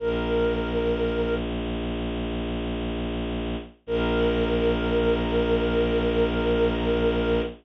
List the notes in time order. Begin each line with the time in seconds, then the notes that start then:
0.00 A#1 A#4
3.86 A#1 A#4